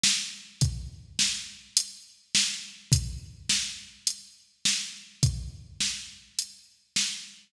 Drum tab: HH |--|x---x---|x---x---|x---x---|
SD |o-|--o---o-|--o---o-|--o---o-|
BD |--|o-------|o-------|o-------|